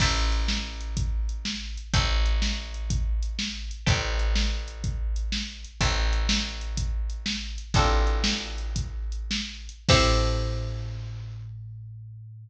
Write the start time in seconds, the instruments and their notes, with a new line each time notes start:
0.00 electric bass (finger) A1, acoustic guitar (steel) C5 E5 G5 A5, kick, crash
0.32 closed hi-hat
0.48 snare
0.81 closed hi-hat
0.97 kick, closed hi-hat
1.29 closed hi-hat
1.45 snare
1.77 closed hi-hat
1.93 electric bass (finger) A1, acoustic guitar (steel) C5 E5 G5 A5, kick, closed hi-hat
2.26 closed hi-hat
2.42 snare
2.74 closed hi-hat
2.90 kick, closed hi-hat
3.23 closed hi-hat
3.39 snare
3.71 closed hi-hat
3.86 electric bass (finger) A1, acoustic guitar (steel) C5 E5 G5 A5, kick, closed hi-hat
4.19 closed hi-hat
4.35 snare
4.68 closed hi-hat
4.84 kick, closed hi-hat
5.16 closed hi-hat
5.32 snare
5.65 closed hi-hat
5.81 electric bass (finger) A1, acoustic guitar (steel) C5 E5 G5 A5, kick, closed hi-hat
6.13 closed hi-hat
6.29 snare
6.61 closed hi-hat
6.77 kick, closed hi-hat
7.10 closed hi-hat
7.26 snare
7.58 closed hi-hat
7.74 electric bass (finger) A1, acoustic guitar (steel) C4 D4 F4 A4, kick, closed hi-hat
8.07 closed hi-hat
8.24 snare
8.58 closed hi-hat
8.76 kick, closed hi-hat
9.12 closed hi-hat
9.31 snare
9.69 closed hi-hat
9.89 electric bass (finger) A2, acoustic guitar (steel) C4 E4 G4 A4, kick, crash